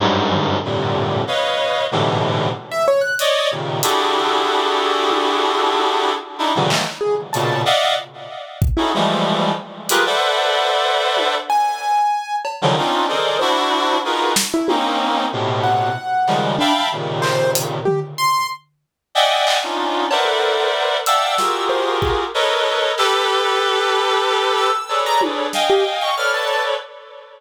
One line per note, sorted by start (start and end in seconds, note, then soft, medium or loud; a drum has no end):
0.00 0.57 F#2 loud
0.00 0.57 G2 loud
0.00 0.57 G#2 loud
0.32 floor tom medium
0.64 1.22 F2 medium
0.64 1.22 G2 medium
0.64 1.22 A2 medium
0.64 1.22 A#2 medium
0.64 1.22 C3 medium
0.64 1.22 D3 medium
1.27 1.84 B4 medium
1.27 1.84 C#5 medium
1.27 1.84 D#5 medium
1.27 1.84 F5 medium
1.91 2.49 G#2 medium
1.91 2.49 A2 medium
1.91 2.49 B2 medium
1.91 2.49 C3 medium
1.91 2.49 D3 medium
1.91 2.49 E3 medium
2.72 2.86 E5 medium
2.88 3.02 C#5 loud
3.01 3.16 F#6 medium
3.19 3.48 C#5 loud
3.19 3.48 D5 loud
3.19 3.48 D#5 loud
3.19 closed hi-hat medium
3.51 3.80 A#2 medium
3.51 3.80 C3 medium
3.51 3.80 C#3 medium
3.51 3.80 D#3 medium
3.82 6.12 D4 medium
3.82 6.12 E4 medium
3.82 6.12 F#4 medium
3.82 6.12 G4 medium
3.82 6.12 G#4 medium
3.82 6.12 A4 medium
3.82 closed hi-hat loud
5.11 high tom medium
5.74 high tom medium
6.38 6.53 D4 medium
6.38 6.53 D#4 medium
6.38 6.53 E4 medium
6.55 6.70 A#2 medium
6.55 6.70 C3 medium
6.55 6.70 C#3 medium
6.55 6.70 D3 medium
6.55 6.69 E3 medium
6.55 6.69 F#3 medium
6.70 6.84 D#3 medium
6.70 6.84 E3 medium
6.70 6.84 F#3 medium
6.70 6.84 G#3 medium
6.70 6.84 A3 medium
6.70 6.84 A#3 medium
6.70 clap loud
7.01 7.15 G#4 medium
7.33 7.63 A#2 medium
7.33 7.63 B2 medium
7.33 7.63 C#3 medium
7.33 7.62 A5 medium
7.33 closed hi-hat medium
7.65 7.94 D5 loud
7.65 7.94 D#5 loud
7.65 7.94 E5 loud
7.65 7.94 F5 loud
7.65 7.94 F#5 loud
8.62 kick loud
8.77 8.91 C#4 medium
8.77 8.91 D#4 medium
8.77 8.91 E4 medium
8.77 8.91 F#4 medium
8.77 8.91 G#4 medium
8.77 8.91 A4 medium
8.94 9.52 E3 medium
8.94 9.52 F3 medium
8.94 9.52 G3 medium
8.94 9.52 G#3 medium
8.94 9.52 A3 medium
9.89 10.04 F4 medium
9.89 10.04 G4 medium
9.89 10.04 G#4 medium
9.89 10.04 A#4 medium
9.89 10.04 B4 medium
9.89 10.03 F#6 medium
9.89 closed hi-hat loud
10.06 11.35 A4 medium
10.06 11.35 B4 medium
10.06 11.35 C5 medium
10.06 11.35 D5 medium
10.06 11.35 E5 medium
10.06 11.35 F#5 medium
11.17 high tom medium
11.50 12.36 G#5 medium
12.45 cowbell medium
12.62 12.76 C#3 medium
12.62 12.76 D3 medium
12.62 12.76 D#3 medium
12.62 12.76 F3 medium
12.62 12.76 F#3 medium
12.77 13.06 C4 medium
12.77 13.06 C#4 medium
12.77 13.06 D4 medium
12.77 13.06 D#4 medium
12.77 13.06 F4 medium
13.08 13.37 G#4 medium
13.08 13.37 A4 medium
13.08 13.37 A#4 medium
13.08 13.37 C5 medium
13.08 13.37 D5 medium
13.08 13.37 D#5 medium
13.39 13.98 D4 loud
13.39 13.98 E4 loud
13.39 13.98 F#4 loud
13.39 13.97 C5 medium
14.04 14.33 D#4 medium
14.04 14.33 F4 medium
14.04 14.33 F#4 medium
14.04 14.33 G#4 medium
14.04 14.33 A#4 medium
14.04 14.33 B4 medium
14.36 snare loud
14.54 14.68 E4 medium
14.68 15.26 A#3 medium
14.68 15.26 C4 medium
14.68 15.26 C#4 medium
14.68 15.26 D#4 medium
14.68 high tom medium
15.32 15.90 A2 medium
15.32 15.90 B2 medium
15.32 15.90 C3 medium
15.64 16.50 F#5 medium
16.27 16.56 C#3 medium
16.27 16.56 D#3 medium
16.27 16.56 F3 medium
16.27 16.56 G3 medium
16.27 16.56 G#3 medium
16.27 clap medium
16.59 16.73 D4 loud
16.59 16.88 E5 loud
16.59 16.88 F5 loud
16.59 16.88 G5 loud
16.59 16.88 A5 loud
16.59 16.88 B5 loud
16.92 17.78 A#2 medium
16.92 17.78 C3 medium
16.92 17.78 C#3 medium
16.92 17.78 D#3 medium
17.22 17.51 C5 loud
17.22 clap medium
17.55 closed hi-hat loud
17.85 18.00 G4 medium
17.85 floor tom medium
18.18 18.47 C6 loud
19.15 19.58 D5 medium
19.15 19.58 D#5 medium
19.15 19.58 E5 medium
19.15 19.58 F#5 medium
19.15 19.58 G5 medium
19.15 19.58 G#5 medium
19.47 clap loud
19.63 20.06 C#4 medium
19.63 20.06 D4 medium
19.63 20.06 D#4 medium
19.63 20.06 F4 medium
20.11 20.97 A#4 medium
20.11 20.97 B4 medium
20.11 20.97 C5 medium
20.11 20.97 D5 medium
20.11 20.97 E5 medium
20.11 20.97 F#5 medium
20.11 cowbell loud
20.25 20.68 A4 medium
21.06 21.35 D5 medium
21.06 21.35 E5 medium
21.06 21.35 F5 medium
21.06 21.35 F#5 medium
21.06 21.35 G5 medium
21.06 21.35 A5 medium
21.06 21.64 E6 medium
21.06 closed hi-hat medium
21.38 22.24 F4 medium
21.38 22.24 F#4 medium
21.38 22.24 G4 medium
21.38 22.24 G#4 medium
21.38 22.24 A#4 medium
21.38 snare medium
21.69 21.98 C5 medium
22.02 22.17 G#4 medium
22.02 kick medium
22.34 22.91 A4 medium
22.34 22.91 A#4 medium
22.34 22.91 B4 medium
22.34 22.91 C#5 medium
22.34 22.91 D#5 medium
22.98 24.70 G4 loud
22.98 24.70 A4 loud
22.98 24.70 B4 loud
22.98 23.14 E6 medium
22.98 clap medium
24.57 25.00 E6 medium
24.89 25.46 G#4 medium
24.89 25.46 A4 medium
24.89 25.46 B4 medium
24.89 25.46 C#5 medium
24.89 25.46 D5 medium
24.89 cowbell medium
25.06 25.21 A#5 loud
25.21 high tom medium
25.53 26.11 D#5 medium
25.53 26.11 F5 medium
25.53 26.11 G5 medium
25.53 26.11 G#5 medium
25.53 snare medium
25.70 25.84 G4 medium
26.01 26.16 C#6 medium
26.17 26.74 A4 medium
26.17 26.74 B4 medium
26.17 26.74 C#5 medium
26.17 26.74 D5 medium
26.17 26.32 F6 medium
26.34 26.63 A5 medium